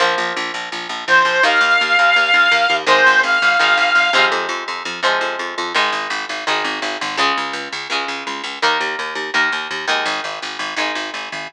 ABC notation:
X:1
M:4/4
L:1/8
Q:1/4=167
K:Ab
V:1 name="Lead 1 (square)"
z6 c2 | f8 | c2 f6 | z8 |
z8 | z8 | z8 | z8 |]
V:2 name="Acoustic Guitar (steel)"
[F,B,]8 | [E,B,]8 | [E,A,]4 [E,A,]3 [C,F,A,]- | [C,F,A,]4 [C,F,A,]4 |
[E,A,]4 [E,A,]4 | [D,A,]4 [D,A,]4 | [E,B,]4 [E,B,]3 [E,A,]- | [E,A,]4 [E,A,]4 |]
V:3 name="Electric Bass (finger)" clef=bass
B,,, B,,, B,,, B,,, B,,, B,,, B,,, B,,, | E,, E,, E,, E,, E,, E,, E,, E,, | A,,, A,,, A,,, A,,, A,,, A,,, A,,, A,,, | F,, F,, F,, F,, F,, F,, F,, F,, |
A,,, A,,, A,,, A,,, A,,, A,,, A,,, A,,, | D,, D,, D,, D,, D,, D,, D,, D,, | E,, E,, E,, E,, E,, E,, E,, E,, | A,,, A,,, A,,, A,,, A,,, A,,, A,,, A,,, |]